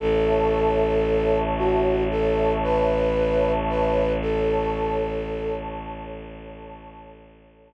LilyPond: <<
  \new Staff \with { instrumentName = "Flute" } { \time 4/4 \key a \lydian \tempo 4 = 57 a'4. fis'8 a'8 b'4 b'8 | a'4. r2 r8 | }
  \new Staff \with { instrumentName = "Pad 2 (warm)" } { \time 4/4 \key a \lydian <cis'' e'' a''>1 | <a' cis'' a''>1 | }
  \new Staff \with { instrumentName = "Violin" } { \clef bass \time 4/4 \key a \lydian a,,1~ | a,,1 | }
>>